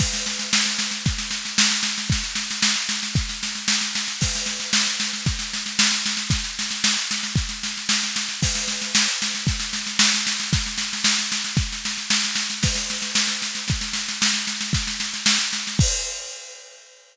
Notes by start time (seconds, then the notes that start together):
0.00 kick, snare, crash
0.13 snare
0.26 snare
0.39 snare
0.53 snare
0.66 snare
0.79 snare
0.91 snare
1.06 kick, snare
1.18 snare
1.31 snare
1.45 snare
1.58 snare
1.71 snare
1.83 snare
1.98 snare
2.10 kick, snare
2.24 snare
2.35 snare
2.51 snare
2.62 snare
2.76 snare
2.89 snare
3.03 snare
3.15 kick, snare
3.29 snare
3.43 snare
3.55 snare
3.68 snare
3.81 snare
3.95 snare
4.08 snare
4.21 kick, snare, crash
4.35 snare
4.46 snare
4.60 snare
4.73 snare
4.87 snare
5.00 snare
5.13 snare
5.26 kick, snare
5.39 snare
5.53 snare
5.66 snare
5.79 snare
5.92 snare
6.06 snare
6.17 snare
6.30 kick, snare
6.44 snare
6.59 snare
6.71 snare
6.84 snare
6.97 snare
7.11 snare
7.23 snare
7.36 kick, snare
7.49 snare
7.63 snare
7.77 snare
7.89 snare
8.03 snare
8.16 snare
8.29 snare
8.42 kick, snare, crash
8.55 snare
8.68 snare
8.81 snare
8.95 snare
9.08 snare
9.22 snare
9.35 snare
9.47 kick, snare
9.60 snare
9.73 snare
9.87 snare
9.99 snare
10.14 snare
10.27 snare
10.40 snare
10.53 kick, snare
10.66 snare
10.78 snare
10.93 snare
11.04 snare
11.19 snare
11.32 snare
11.44 snare
11.57 kick, snare
11.72 snare
11.85 snare
11.98 snare
12.10 snare
12.24 snare
12.36 snare
12.50 snare
12.63 kick, snare, crash
12.75 snare
12.90 snare
13.02 snare
13.15 snare
13.28 snare
13.42 snare
13.55 snare
13.68 kick, snare
13.81 snare
13.93 snare
14.08 snare
14.22 snare
14.33 snare
14.47 snare
14.61 snare
14.73 kick, snare
14.87 snare
15.00 snare
15.14 snare
15.26 snare
15.39 snare
15.53 snare
15.67 snare
15.79 kick, crash